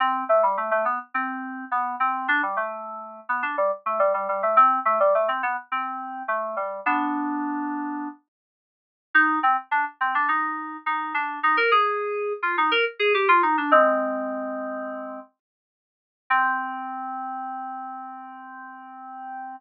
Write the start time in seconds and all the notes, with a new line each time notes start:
0.00 C4
0.29 A3
0.43 G3
0.57 A3
0.71 A3
0.85 B3
1.14 C4
1.71 B3
2.00 C4
2.28 D4
2.43 G3
2.57 A3
3.29 B3
3.43 D4
3.58 G3
3.86 A3
3.99 G3
4.14 G3
4.29 G3
4.43 A3
4.57 C4
4.85 A3
5.00 G3
5.15 A3
5.28 C4
5.43 B3
5.72 C4
6.28 A3
6.57 G3
6.86 B3 D4
9.14 D#4
9.43 C4
9.71 D4
10.01 C4
10.15 D4
10.28 D#4
10.86 D#4
11.14 D4
11.43 D#4
11.57 A#4
11.71 G#4
12.43 F4
12.58 D#4
12.71 A#4
12.99 G#4
13.14 G4
13.28 F4
13.43 D#4
13.58 D4
13.71 G#3 C4
16.30 C4